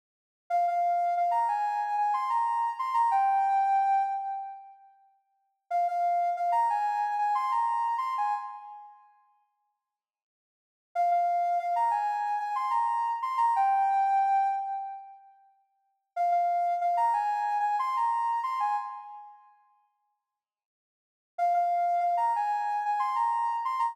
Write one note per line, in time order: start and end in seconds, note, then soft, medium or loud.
0.50 0.65 F5 loud
0.68 1.14 F5 loud
1.17 1.33 F5 medium
1.31 1.47 A#5 loud
1.48 1.96 G#5 medium
1.98 2.14 G#5 medium
2.14 2.29 C6 medium
2.30 2.70 A#5 medium
2.79 2.94 C6 medium
2.94 3.10 A#5 loud
3.11 4.02 G5 loud
5.71 5.86 F5 loud
5.88 6.30 F5 loud
6.37 6.52 F5 medium
6.52 6.68 A#5 loud
6.70 7.14 G#5 loud
7.19 7.34 G#5 medium
7.35 7.50 C6 loud
7.51 7.95 A#5 medium
7.98 8.13 C6 medium
8.18 8.33 G#5 medium
10.95 11.11 F5 loud
11.11 11.58 F5 loud
11.59 11.75 F5 medium
11.76 11.91 A#5 loud
11.91 12.39 G#5 medium
12.40 12.55 G#5 medium
12.55 12.71 C6 medium
12.71 13.11 A#5 medium
13.22 13.38 C6 medium
13.38 13.53 A#5 loud
13.56 14.47 G5 loud
16.16 16.31 F5 loud
16.32 16.74 F5 loud
16.81 16.97 F5 medium
16.97 17.13 A#5 loud
17.13 17.58 G#5 loud
17.60 17.76 G#5 medium
17.79 17.95 C6 loud
17.97 18.40 A#5 medium
18.43 18.59 C6 medium
18.60 18.75 G#5 medium
21.38 21.53 F5 loud
21.54 22.00 F5 loud
22.00 22.16 F5 medium
22.17 22.33 A#5 loud
22.36 22.84 G#5 medium
22.85 23.01 G#5 medium
22.99 23.15 C6 medium
23.16 23.56 A#5 medium
23.65 23.80 C6 medium
23.79 23.95 A#5 loud